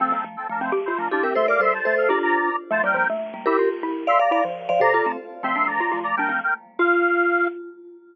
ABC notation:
X:1
M:6/8
L:1/8
Q:3/8=162
K:F
V:1 name="Lead 1 (square)"
[CA]2 z [CA] [DB] [Ec] | [M:5/8] z [Ec] [DB] [Fd] [Ge] | [M:6/8] [ec'] [fd'] [ec'] [ca]2 [Af] | [M:5/8] [db] [db]3 z |
[M:6/8] [ca] [Bg] [Bg] z3 | [M:5/8] [Ge] z4 | [M:6/8] [ec'] [db] [db] z3 | [M:5/8] [db]3 z2 |
[M:6/8] [ec']2 [db]3 [db] | [M:5/8] [Bg]2 [Bg] z2 | [M:6/8] f6 |]
V:2 name="Vibraphone"
[F,A,] [G,B,] [F,A,] z [F,A,]2 | [M:5/8] z2 [F,A,] [EG] [GB] | [M:6/8] [Ac] [Bd] [Ac] z [Ac]2 | [M:5/8] [DF]4 z |
[M:6/8] [F,A,] [G,B,] [G,B,] z2 [G,B,] | [M:5/8] [GB]2 z3 | [M:6/8] [df] [df] [df] z2 [df] | [M:5/8] [Ac] [FA] [A,C] z2 |
[M:6/8] [F,A,] [G,B,] [F,A,] z [F,A,]2 | [M:5/8] [G,B,] [F,A,] z3 | [M:6/8] F6 |]
V:3 name="Xylophone"
C B, z3 C | [M:5/8] G F2 D C | [M:6/8] A,2 G,2 A,2 | [M:5/8] G2 z3 |
[M:6/8] A, G, F, A,3 | [M:5/8] E F2 E2 | [M:6/8] z2 E F,2 F, | [M:5/8] C,2 z3 |
[M:6/8] C D2 F F z | [M:5/8] D C z3 | [M:6/8] F6 |]